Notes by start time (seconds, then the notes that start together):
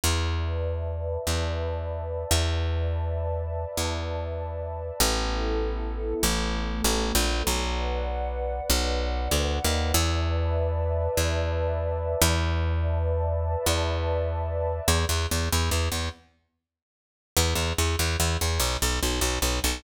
0.03 E2 B4 D5 E5 A5
1.27 E2
2.31 E2
2.52 B4 D5 E5 A5
3.77 E2
5.00 A1 B3 E4 A4
6.23 A1 A3 B3 A4
6.84 A1
7.15 A#1
7.46 B1 B4 D5 F#5
8.70 B1
9.31 D2
9.64 D#2
9.94 E2 B4 D5 E5 A5
11.17 E2
12.21 E2
12.41 B4 D5 E5 A5
13.66 E2
14.88 E2
15.09 E2
15.31 E2
15.52 E2
15.71 E2
15.92 E2
17.37 E2
17.55 E2
17.78 E2
17.99 E2
18.20 E2
18.41 E2
18.60 B1
18.82 B1
19.03 B1
19.21 B1
19.42 B1
19.64 B1